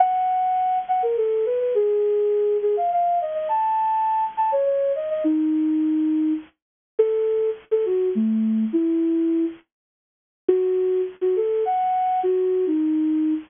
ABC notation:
X:1
M:3/4
L:1/16
Q:1/4=103
K:F#dor
V:1 name="Flute"
f6 f _B A2 =B B | G6 G ^e e2 d d | a6 a c c2 d d | D8 z4 |
A4 z A F2 A,4 | E6 z6 | F4 z F A2 f4 | F3 D5 z4 |]